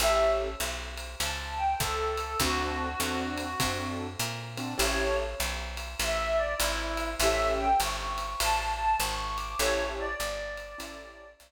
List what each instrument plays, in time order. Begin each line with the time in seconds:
0.00 electric bass (finger) A1, acoustic grand piano C#4 E4 G4 A4, clarinet E5, ride
0.60 electric bass (finger) B1, hi-hat pedal, ride
0.97 ride
1.20 electric bass (finger) C#2, clarinet A5, ride
1.57 clarinet G5
1.79 electric bass (finger) C#2, clarinet A4, kick, hi-hat pedal, ride
2.17 ride
2.40 electric bass (finger) D2, acoustic grand piano C4 D4 F#4 A4, clarinet F#4, kick, ride
3.00 electric bass (finger) E2, acoustic grand piano C4 D4 F#4 A4, hi-hat pedal, ride
3.38 ride
3.60 electric bass (finger) F#2, acoustic grand piano C4 D4 F#4 A4, kick, ride
4.20 electric bass (finger) A#2, hi-hat pedal, ride
4.57 acoustic grand piano C4 D4 F#4 A4, ride
4.78 electric bass (finger) A1, acoustic grand piano C#4 E4 G4 A4, ride
4.82 clarinet C#5
5.40 electric bass (finger) B1, hi-hat pedal, ride
5.77 ride
6.00 electric bass (finger) A1, clarinet E5, ride
6.37 clarinet D5
6.58 electric bass (finger) G#1, clarinet E4, hi-hat pedal, ride
6.97 ride
7.20 electric bass (finger) A1, acoustic grand piano C#4 E4 G4 A4, clarinet E5, ride
7.58 clarinet G5
7.80 electric bass (finger) G1, clarinet C#6, hi-hat pedal, ride
8.18 ride
8.40 electric bass (finger) A1, clarinet A5, ride
8.76 clarinet A5
9.00 electric bass (finger) G#1, clarinet C#6, hi-hat pedal, ride
9.36 clarinet D6, ride
9.58 electric bass (finger) A1, acoustic grand piano C#4 E4 G4 A4, clarinet C#5, ride
9.98 clarinet D5
10.20 electric bass (finger) G1, hi-hat pedal, ride
10.57 ride
10.78 electric bass (finger) A1, acoustic grand piano C#4 E4 G4 A4, ride
11.40 electric bass (finger) B1, hi-hat pedal, ride